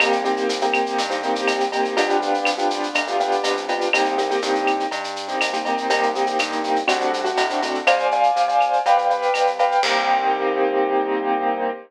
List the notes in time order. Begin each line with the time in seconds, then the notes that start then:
0.00 C2 A#3 C4 D#4 G4, cowbell, claves, shaker
0.12 shaker
0.24 A#3 C4 D#4 G4, shaker
0.37 shaker
0.49 C2, shaker
0.61 A#3 C4 D#4 G4, shaker
0.74 claves, shaker
0.86 shaker
0.98 G2, cowbell, shaker
1.10 A#3 C4 D#4 G4, shaker
1.23 A#3 C4 D#4 G4, shaker
1.35 shaker
1.47 C2, cowbell, claves, shaker
1.60 shaker
1.72 A#3 C4 D#4 G4, cowbell, shaker
1.85 shaker
1.97 C2 B3 D4 F4 G4, cowbell, shaker
2.10 shaker
2.20 B3 D4 F4 G4, shaker
2.34 shaker
2.45 C2, claves, shaker
2.58 B3 D4 F4 G4, shaker
2.70 shaker
2.83 shaker
2.95 D2, cowbell, claves, shaker
3.07 B3 D4 F4 G4, shaker
3.20 B3 D4 F4 G4, shaker
3.32 shaker
3.44 C2, cowbell, shaker
3.57 shaker
3.68 B3 D4 F4 G4, cowbell, shaker
3.81 shaker
3.93 C2 A#3 C4 D#4 G4, cowbell, claves, shaker
4.05 shaker
4.18 A#3 C4 D#4 G4, shaker
4.30 A#3 C4 D#4 G4, shaker
4.42 G2 A#3 C4 D#4 G4, shaker
4.55 shaker
4.67 claves, shaker
4.80 shaker
4.91 G2, cowbell, shaker
5.04 shaker
5.16 shaker
5.28 A#3 C4 D#4 G4, shaker
5.41 C2, cowbell, claves, shaker
5.53 A#3 C4 D#4 G4, shaker
5.65 A#3 C4 D#4 G4, cowbell, shaker
5.78 shaker
5.90 C2 A#3 C4 D#4 G4, cowbell, shaker
6.03 shaker
6.15 A#3 C4 D#4 G4, shaker
6.26 A#3 C4 D#4 G4, shaker
6.39 G2 A#3 C4 D#4 G4, claves, shaker
6.52 shaker
6.64 shaker
6.76 shaker
6.87 C2 A3 C4 D4 F#4, cowbell, claves, shaker
7.01 shaker
7.14 shaker
7.24 A3 C4 D4 F#4, shaker
7.37 A2, cowbell, shaker
7.50 A3 C4 D4 F#4, shaker
7.62 A3 C4 D4 F#4, cowbell, shaker
7.74 shaker
7.87 C2 C5 D5 F5 G#5, cowbell, claves, shaker
7.99 shaker
8.11 C5 D5 F5 G#5, shaker
8.23 shaker
8.36 C2, shaker
8.48 C5 D5 F5 G#5, shaker
8.61 claves, shaker
8.73 shaker
8.85 C2 B4 D5 F5 G5, cowbell, shaker
8.97 B4 D5 F5 G5, shaker
9.10 B4 D5 F5 G5, shaker
9.22 shaker
9.34 C2, cowbell, claves, shaker
9.47 shaker
9.59 B4 D5 F5 G5, cowbell, shaker
9.72 shaker
9.83 C2 A#3 C4 D#4 G4, kick, crash